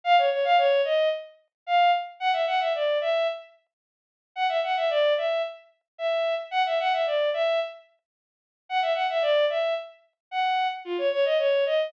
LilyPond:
\new Staff { \time 2/2 \key f \minor \tempo 2 = 111 f''8 des''8 des''8 f''8 des''4 ees''4 | r2 f''4 r4 | \key fis \minor fis''8 e''8 fis''8 e''8 d''4 e''4 | r1 |
fis''8 e''8 fis''8 e''8 d''4 e''4 | r2 e''4. r8 | fis''8 e''8 fis''8 e''8 d''4 e''4 | r1 |
fis''8 e''8 fis''8 e''8 d''4 e''4 | r2 fis''4. r8 | \key f \minor f'8 des''8 des''8 ees''8 des''4 ees''4 | }